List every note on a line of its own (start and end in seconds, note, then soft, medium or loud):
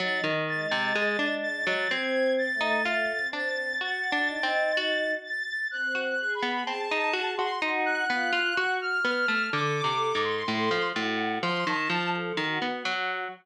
0.00 0.21 F#3 medium
0.00 0.43 D#4 medium
0.00 0.22 A6 medium
0.24 0.66 D#3 medium
0.48 1.76 G#3 medium
0.48 1.33 A6 medium
0.71 0.93 C3 medium
0.95 1.17 G#3 loud
1.19 1.62 D4 medium
1.43 1.86 A6 loud
1.67 1.88 F#3 medium
1.90 2.48 C4 loud
1.90 2.55 C4 loud
1.90 2.33 G#6 medium
2.38 3.24 A6 loud
2.54 3.12 A3 medium
2.61 2.82 D#4 medium
2.85 3.28 F4 medium
3.18 3.75 C4 medium
3.33 3.76 D4 medium
3.33 3.77 A6 medium
3.81 4.10 F#4 medium
3.81 4.24 F#4 medium
3.81 5.10 A6 medium
4.12 4.41 D4 medium
4.28 5.14 D#4 medium
4.43 4.72 C4 medium
4.77 5.63 F#4 loud
5.23 5.66 A6 medium
5.71 6.14 C4 medium
5.71 5.99 F#6 medium
5.95 6.16 F#4 medium
6.03 6.32 F#6 medium
6.20 7.49 G#4 medium
6.35 6.63 B5 medium
6.42 6.64 B3 medium
6.67 6.89 C4 soft
6.67 7.31 A5 loud
6.91 7.13 D#4 loud
7.13 7.35 F#4 loud
7.38 7.60 F#4 medium
7.38 7.59 C6 loud
7.62 8.05 D#4 loud
7.62 8.05 F#4 medium
7.86 8.71 F#6 medium
8.10 8.31 B3 medium
8.10 8.53 F4 medium
8.33 8.54 F4 loud
8.57 8.78 F#4 loud
8.57 9.00 F#4 loud
8.81 9.46 F6 medium
9.05 9.26 B3 medium
9.28 9.50 A3 medium
9.53 9.82 D3 medium
9.53 10.81 A4 medium
9.53 10.17 D6 medium
9.84 10.13 C3 soft
10.15 10.43 G#2 medium
10.23 10.88 C6 medium
10.48 10.69 A2 medium
10.71 10.92 F3 medium
10.96 11.39 A2 medium
10.96 11.39 F#4 medium
11.43 11.64 F3 loud
11.43 11.64 C6 loud
11.66 11.88 D#3 loud
11.66 12.09 A5 medium
11.90 12.33 F3 loud
12.14 12.35 A4 medium
12.37 12.59 D#3 loud
12.37 13.24 F#4 medium
12.62 12.83 B3 medium
12.85 13.28 F#3 loud